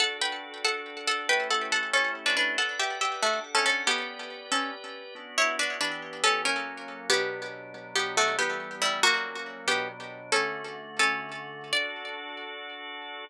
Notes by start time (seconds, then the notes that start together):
0.00 D4 F#4 A4 F#5
0.22 B4 G5
0.65 A4 F#5
1.07 A4 F#5
1.29 A3 C#4 E4 G4 B4 G5
1.51 A4 F#5
1.72 A4 F#5
1.93 C#4 A4
2.26 D4 B4
2.37 D4 B4
2.58 A4 B4 D5 F#5
2.79 G4 E5
3.01 G4 E5
3.22 A3 D4 F#4 A4 F#5
3.55 C#4 A4
3.66 C#4 A4
3.86 B3 G4 B4 D5
4.52 C#4 A4
5.15 B3 D4 F#4
5.38 E4 C#5
5.59 D4 B4
5.81 E3 B3 D4 G4 B4
6.24 C#4 A4
6.45 F#3 A#3 C#4 A#4
7.10 B2 F#3 B3 D4 G4
7.74 B2 F#3 D4
7.96 B3 G4
8.17 A3 F#4
8.39 E3 G3 B3 G4
8.82 G3 E4
9.03 F#3 A#3 C#4 F#4
9.67 B2 F#3 B3 D4 G4
10.32 D3 A3 C#4 F#4 A4
10.99 C#4 A4
11.73 D4 F#4 A4 D5